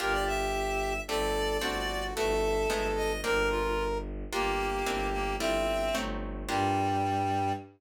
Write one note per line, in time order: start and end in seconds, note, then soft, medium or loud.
0.00 0.99 G1 loud
0.00 1.06 A#3 loud
0.00 1.06 D4 loud
0.00 1.06 F4 loud
0.00 0.93 G4 loud
0.00 1.06 G4 medium
0.00 0.13 A#4 loud
0.12 0.25 D5 loud
0.27 1.01 E5 loud
1.08 1.58 G1 loud
1.08 1.61 A3 medium
1.08 1.61 C4 medium
1.08 1.61 D4 medium
1.08 1.62 G4 loud
1.08 1.58 A4 loud
1.08 2.04 D5 loud
1.61 2.12 G1 medium
1.61 2.14 A3 loud
1.61 2.14 C4 loud
1.61 2.14 D4 loud
1.61 2.14 F#4 medium
1.61 2.14 F#4 loud
2.15 2.66 G1 loud
2.15 2.69 A3 loud
2.15 2.69 B3 medium
2.15 2.70 E4 loud
2.15 2.70 F#4 loud
2.15 3.12 A4 loud
2.15 2.88 E5 loud
2.70 3.20 G1 loud
2.70 3.23 G#3 loud
2.70 3.23 A3 loud
2.70 3.23 B3 loud
2.70 3.23 D#4 loud
2.96 3.21 D#5 loud
3.24 4.24 G1 loud
3.24 4.30 A#3 medium
3.24 4.30 C4 loud
3.24 4.30 D4 loud
3.24 4.30 F4 loud
3.24 3.48 A#4 loud
3.24 3.98 A#4 loud
3.50 3.85 F4 loud
4.32 4.82 G1 medium
4.32 4.85 A#3 loud
4.32 5.08 A#3 loud
4.32 4.85 D4 loud
4.32 4.85 F4 loud
4.32 5.36 G4 loud
4.32 4.85 G4 medium
4.86 5.36 G1 loud
4.86 5.39 A#3 loud
4.86 5.39 C4 loud
4.86 5.39 D4 loud
4.86 5.39 E4 medium
5.13 5.36 A#3 loud
5.39 5.90 G1 medium
5.39 5.93 G3 loud
5.39 5.93 A3 loud
5.39 6.01 C4 loud
5.39 5.93 E4 loud
5.39 5.93 F4 loud
5.39 5.96 E5 loud
5.95 6.44 G1 loud
5.95 6.48 F#3 medium
5.95 6.48 A3 medium
5.95 6.48 C4 loud
5.95 6.48 D#4 loud
6.49 7.52 G2 loud
6.49 7.52 G3 loud
6.49 7.52 A#3 loud
6.49 7.52 D4 loud
6.49 7.52 F4 loud
6.49 7.52 G4 medium
6.49 7.53 G5 loud